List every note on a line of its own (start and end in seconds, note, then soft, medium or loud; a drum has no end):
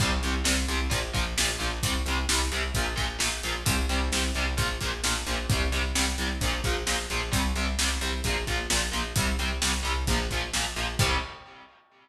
0.00 0.19 C2 loud
0.00 0.10 C3 medium
0.00 0.10 G3 medium
0.00 kick loud
0.00 crash loud
0.23 0.43 C2 medium
0.23 0.33 C3 medium
0.23 0.33 G3 medium
0.23 closed hi-hat medium
0.44 0.65 C2 loud
0.44 0.53 C3 medium
0.44 0.53 G3 medium
0.44 snare loud
0.68 0.88 C2 loud
0.68 0.78 C3 medium
0.68 0.78 G3 medium
0.68 closed hi-hat medium
0.90 1.11 A#1 loud
0.90 0.99 A#2 medium
0.90 0.99 F3 medium
0.90 kick medium
0.90 closed hi-hat medium
1.13 1.34 A#1 loud
1.13 1.23 A#2 medium
1.13 1.23 F3 medium
1.13 kick medium
1.13 closed hi-hat medium
1.37 1.57 A#1 medium
1.37 1.48 A#2 medium
1.37 1.48 F3 medium
1.37 snare loud
1.59 1.80 A#1 loud
1.59 1.68 A#2 medium
1.59 1.68 F3 medium
1.59 closed hi-hat medium
1.83 2.02 C2 loud
1.83 1.93 C3 medium
1.83 1.93 G3 medium
1.83 kick medium
1.83 closed hi-hat loud
2.06 2.25 C2 medium
2.06 2.17 C3 medium
2.06 2.17 G3 medium
2.06 closed hi-hat medium
2.29 2.49 C2 medium
2.29 2.39 C3 medium
2.29 2.39 G3 medium
2.29 snare loud
2.52 2.71 C2 medium
2.52 2.61 C3 medium
2.52 2.61 G3 medium
2.52 closed hi-hat medium
2.74 2.94 A#1 loud
2.74 2.85 A#2 medium
2.74 2.85 F3 medium
2.74 kick medium
2.74 closed hi-hat medium
2.96 3.17 A#1 medium
2.96 3.05 A#2 medium
2.96 3.05 F3 medium
2.96 kick medium
2.96 closed hi-hat medium
3.19 3.40 A#1 medium
3.19 3.28 A#2 medium
3.19 3.28 F3 medium
3.19 snare loud
3.43 3.63 A#1 medium
3.43 3.53 A#2 medium
3.43 3.53 F3 medium
3.43 closed hi-hat medium
3.66 3.86 C2 loud
3.66 3.75 C3 medium
3.66 3.75 G3 loud
3.66 kick loud
3.66 closed hi-hat loud
3.89 4.09 C2 loud
3.89 3.98 C3 medium
3.89 3.98 G3 medium
3.89 closed hi-hat medium
4.12 4.31 C2 medium
4.12 4.22 C3 medium
4.12 4.22 G3 medium
4.12 snare loud
4.35 4.55 C2 loud
4.35 4.45 C3 medium
4.35 4.45 G3 medium
4.35 closed hi-hat medium
4.57 4.77 A#1 loud
4.57 4.66 A#2 medium
4.57 4.66 F3 medium
4.57 kick medium
4.57 closed hi-hat medium
4.81 5.01 A#1 medium
4.81 4.90 A#2 medium
4.81 4.90 F3 medium
4.81 kick medium
4.81 closed hi-hat medium
5.04 5.23 A#1 loud
5.04 5.13 A#2 medium
5.04 5.13 F3 medium
5.04 snare loud
5.27 5.46 A#1 loud
5.27 5.36 A#2 medium
5.27 5.36 F3 medium
5.27 closed hi-hat medium
5.49 5.69 C2 loud
5.49 5.61 C3 medium
5.49 5.61 G3 medium
5.49 kick loud
5.49 closed hi-hat medium
5.72 5.92 C2 medium
5.72 5.81 C3 medium
5.72 5.81 G3 medium
5.72 closed hi-hat medium
5.95 6.15 C2 medium
5.95 6.04 C3 medium
5.95 6.04 G3 medium
5.95 snare loud
6.18 6.38 C2 medium
6.18 6.28 C3 medium
6.18 6.28 G3 medium
6.18 closed hi-hat medium
6.41 6.61 A#1 loud
6.41 6.52 A#2 medium
6.41 6.52 F3 medium
6.41 kick medium
6.41 closed hi-hat medium
6.64 6.83 A#1 loud
6.64 6.74 A#2 medium
6.64 6.74 F3 medium
6.64 kick medium
6.64 closed hi-hat medium
6.87 7.06 A#1 medium
6.87 6.96 A#2 medium
6.87 6.96 F3 medium
6.87 snare loud
7.10 7.30 A#1 medium
7.10 7.20 A#2 medium
7.10 7.20 F3 medium
7.10 closed hi-hat medium
7.32 7.52 C2 loud
7.32 7.41 C3 medium
7.32 7.41 G3 medium
7.32 kick medium
7.32 closed hi-hat loud
7.56 7.75 C2 medium
7.56 7.65 C3 medium
7.56 7.65 G3 medium
7.56 closed hi-hat medium
7.79 7.98 C2 loud
7.79 7.89 C3 medium
7.79 7.89 G3 medium
7.79 snare loud
8.01 8.21 C2 medium
8.01 8.10 C3 medium
8.01 8.10 G3 medium
8.01 closed hi-hat medium
8.24 8.44 A#1 loud
8.24 8.35 A#2 medium
8.24 8.35 F3 medium
8.24 kick medium
8.24 closed hi-hat medium
8.47 8.67 A#1 medium
8.47 8.57 A#2 medium
8.47 8.57 F3 medium
8.47 kick medium
8.47 closed hi-hat medium
8.70 8.90 A#1 loud
8.70 8.79 A#2 medium
8.70 8.79 F3 medium
8.70 snare loud
8.92 9.13 A#1 medium
8.92 9.01 A#2 medium
8.92 9.01 F3 medium
8.92 closed hi-hat medium
9.16 9.35 C2 loud
9.16 9.26 C3 medium
9.16 9.26 G3 medium
9.16 kick loud
9.16 closed hi-hat loud
9.39 9.58 C2 medium
9.39 9.48 C3 medium
9.39 9.48 G3 medium
9.39 closed hi-hat medium
9.62 9.81 C2 medium
9.62 9.71 C3 medium
9.62 9.71 G3 medium
9.62 snare loud
9.83 10.04 C2 medium
9.83 9.92 C3 medium
9.83 9.92 G3 medium
9.83 closed hi-hat medium
10.07 10.27 A#1 loud
10.07 10.17 A#2 medium
10.07 10.17 F3 medium
10.07 kick medium
10.07 closed hi-hat medium
10.31 10.50 A#1 medium
10.31 10.41 A#2 medium
10.31 10.41 F3 medium
10.31 kick medium
10.31 closed hi-hat medium
10.54 10.73 A#1 medium
10.54 10.64 A#2 medium
10.54 10.64 F3 medium
10.54 snare loud
10.76 10.96 A#1 medium
10.76 10.85 A#2 medium
10.76 10.85 F3 medium
10.76 closed hi-hat medium
10.99 11.15 C2 loud
10.99 11.16 C3 medium
10.99 11.16 G3 loud
10.99 kick loud
10.99 crash loud